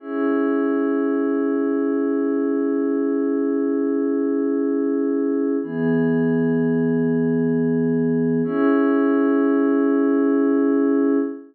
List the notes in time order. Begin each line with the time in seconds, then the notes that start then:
0.00 C#4 E4 G#4
5.63 E3 B3 G#4
8.44 C#4 E4 G#4